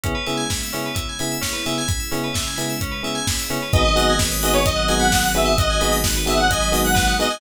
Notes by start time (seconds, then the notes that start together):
0.03 C#3 G#3 B3 C#4 E4 G#4, kick, closed hi-hat
0.15 B4
0.26 C#3 B3 E4 G#4 E5, open hi-hat
0.37 G#5
0.50 B5, kick, snare
0.63 E6
0.73 C#3 B3 C#4 E4 G#4, open hi-hat
0.86 B4
0.95 E5, kick, closed hi-hat
1.09 G#5
1.19 C#3 B3 E4 G#4 B5, open hi-hat
1.32 E6
1.41 C#4, kick, snare
1.53 B4
1.66 C#3 B3 E4 G#4 E5, open hi-hat
1.78 G#5
1.88 C#3 G#3 C#4 E4 B5, kick, closed hi-hat
2.00 E6
2.11 C#3 B3 C#4 E4 G#4, open hi-hat
2.24 B4
2.34 E5, kick, snare
2.47 G#5
2.56 C#3 B3 E4 G#4 B5, open hi-hat
2.69 E6
2.81 C#4, kick, closed hi-hat
2.91 B4
3.03 C#3 B3 E4 G#4 E5, open hi-hat
3.15 G#5
3.27 B5, kick, snare
3.39 E6
3.50 C#3 B3 C#4 E4 G#4, open hi-hat
3.62 B4
3.73 G#1 F#3 G#3 B3 D#4 F#4 G#4 B4 D#5, kick, closed hi-hat
3.85 D#5
3.96 B3 D#4 F#4 G#4 F#5, open hi-hat
4.10 G#5
4.19 B5, kick, snare
4.32 D#6
4.42 B3 D#4 F#4 G#4 D#5 F#6, open hi-hat
4.53 B4 C#5
4.65 D#5, kick, closed hi-hat
4.76 F#5
4.88 B3 D#4 F#4 G#4 G#5, open hi-hat
4.99 F#5 B5
5.12 D#6, kick, snare
5.24 F#6
5.34 B3 D#4 F#4 G#4 B4 E5, open hi-hat
5.45 D#5
5.58 F#3 G#3 D#4 F#4 D#5 F#5, kick, closed hi-hat
5.70 G#5
5.81 B3 D#4 F#4 G#4 B5, open hi-hat
5.92 D#6
6.04 F#6, kick, snare
6.16 B4
6.26 B3 D#4 F#4 G#4 D#5 E5, open hi-hat
6.37 F#5
6.50 D#5 G#5, kick, closed hi-hat
6.61 B5
6.72 B3 D#4 F#4 G#4 D#6, open hi-hat
6.84 F#5 F#6
6.95 B4, kick, snare
7.07 D#5
7.19 B3 D#4 F#4 G#4 D#5 F#5, open hi-hat
7.30 G#5